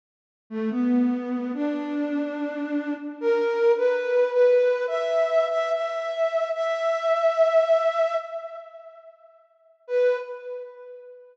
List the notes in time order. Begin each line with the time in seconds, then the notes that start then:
0.50 A3
0.71 B3
1.54 D4
3.21 A#4
3.77 B4
4.32 B4
4.87 E5
5.50 E5
5.71 E5
6.54 E5
9.87 B4